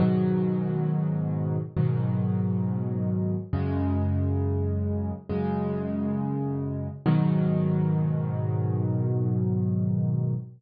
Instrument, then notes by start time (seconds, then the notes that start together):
acoustic grand piano
0.00 G#2 B2 D#3 F#3
1.77 G#2 B2 D#3 F#3
3.53 F#2 C#3 G#3
5.29 F#2 C#3 G#3
7.06 G#2 B2 D#3 F#3